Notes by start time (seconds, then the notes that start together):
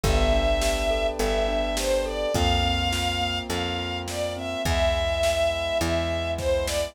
0.03 G1 B3 B4 D5 E5 G5 A5, kick, closed hi-hat
0.33 D4
0.61 G4, snare
0.90 A4
1.19 G1 B3 E5, closed hi-hat
1.48 D4
1.77 G4 C5, snare
2.05 A4 D5
2.34 F2 A#3 C4 F4 F5, kick, closed hi-hat
2.63 C4
2.92 F4, snare
3.21 A#3
3.48 F2 C4 F5, closed hi-hat
3.78 F4
4.07 A#3 D5, snare
4.37 C4 E5
4.65 E2 G#3 B3 E4 E5, kick, closed hi-hat
5.23 snare
5.81 E2 E5, closed hi-hat
6.38 C5, kick, snare
6.66 D5, snare